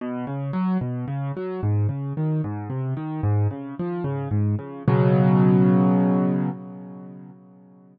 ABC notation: X:1
M:6/8
L:1/8
Q:3/8=74
K:B
V:1 name="Acoustic Grand Piano" clef=bass
B,, C, F, B,, C, F, | G,, C, D, G,, ^B,, D, | G,, C, ^E, C, G,, C, | [B,,C,F,]6 |]